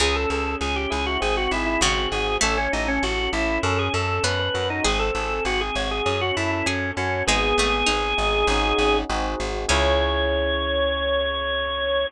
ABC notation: X:1
M:4/4
L:1/16
Q:1/4=99
K:C#m
V:1 name="Drawbar Organ"
G A A2 G =G ^G F G F E E F2 G2 | A C D C F2 E2 A G A2 B B B D | G A A2 F G c G G F E E C2 C2 | G14 z2 |
c16 |]
V:2 name="Harpsichord"
C,4 z8 C,4 | A,4 z8 B,4 | G4 z8 G4 | G,2 A,2 D4 z8 |
C16 |]
V:3 name="Electric Piano 1"
C2 G2 C2 E2 ^B,2 G2 B,2 F2 | C2 A2 C2 E2 C2 A2 C2 F2 | ^B,2 G2 B,2 F2 C2 A2 C2 F2 | B,2 G2 B,2 D2 [CDFG]4 [^B,DFG]4 |
[CEG]16 |]
V:4 name="Electric Bass (finger)" clef=bass
C,,2 C,,2 C,,2 C,,2 G,,,2 G,,,2 G,,,2 G,,,2 | A,,,2 A,,,2 A,,,2 A,,,2 F,,2 F,,2 F,,2 F,,2 | G,,,2 G,,,2 G,,,2 G,,,2 F,,2 F,,2 F,,2 F,,2 | G,,,2 G,,,2 G,,,2 G,,,2 G,,,2 G,,,2 G,,,2 G,,,2 |
C,,16 |]